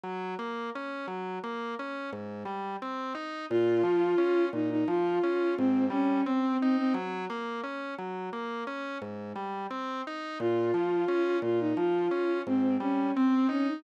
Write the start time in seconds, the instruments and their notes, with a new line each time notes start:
0.04 drawbar organ F#3
0.39 drawbar organ A#3
0.75 drawbar organ C#4
1.08 drawbar organ F#3
1.44 drawbar organ A#3
1.79 drawbar organ C#4
2.13 drawbar organ G#2
2.45 drawbar organ G3
2.82 drawbar organ C4
3.15 drawbar organ D#4
3.50 drawbar organ A#2, violin F4
3.83 drawbar organ F3
4.18 drawbar organ C#4
4.53 drawbar organ A#2, violin D#4
4.71 violin D#4
4.88 drawbar organ F3, violin F4
5.23 drawbar organ C#4
5.57 drawbar organ G#2, violin C4
5.90 drawbar organ G3, violin C#4
6.25 violin C4, drawbar organ C4
6.60 violin C4, drawbar organ D#4
6.77 violin C4
6.94 drawbar organ F#3
7.30 drawbar organ A#3
7.64 drawbar organ C#4
7.98 drawbar organ F#3
8.33 drawbar organ A#3
8.67 drawbar organ C#4
9.02 drawbar organ G#2
9.36 drawbar organ G3
9.71 drawbar organ C4
10.07 drawbar organ D#4
10.40 drawbar organ A#2, violin F4
10.74 drawbar organ F3
11.08 drawbar organ C#4
11.42 drawbar organ A#2, violin F4
11.60 violin D#4
11.77 drawbar organ F3, violin F4
12.11 drawbar organ C#4
12.47 drawbar organ G#2, violin C4
12.80 drawbar organ G3, violin C#4
13.15 violin C4, drawbar organ C4
13.49 violin C#4, drawbar organ D#4
13.67 violin D#4